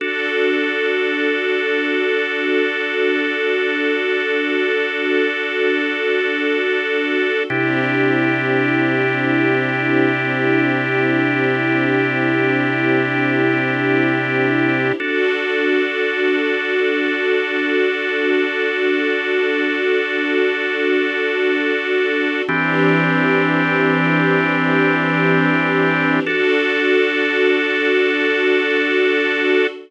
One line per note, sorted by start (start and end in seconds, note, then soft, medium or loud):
0.00 7.42 D4 medium
0.00 7.43 D4 medium
0.00 7.42 F#4 medium
0.00 7.43 F#4 medium
0.00 7.42 A4 loud
0.00 7.43 A4 medium
7.50 14.92 C3 medium
7.50 14.93 C4 medium
7.50 14.92 D4 medium
7.50 14.93 D4 medium
7.50 14.92 E4 medium
7.50 14.93 E4 medium
7.50 14.92 G4 medium
7.50 14.93 G4 medium
15.00 22.42 D4 medium
15.00 22.43 D4 medium
15.00 22.42 F#4 medium
15.00 22.43 F#4 loud
15.00 22.42 A4 medium
15.00 22.43 A4 medium
22.48 26.20 E3 medium
22.48 26.22 E3 medium
22.48 26.20 C4 medium
22.48 26.22 C4 medium
22.48 26.20 D4 loud
22.48 26.22 D4 loud
22.48 26.20 G4 medium
22.48 26.22 G4 medium
26.25 29.66 D4 medium
26.25 29.67 D4 medium
26.25 29.66 F#4 loud
26.25 29.67 F#4 medium
26.25 29.66 A4 loud
26.25 29.67 A4 loud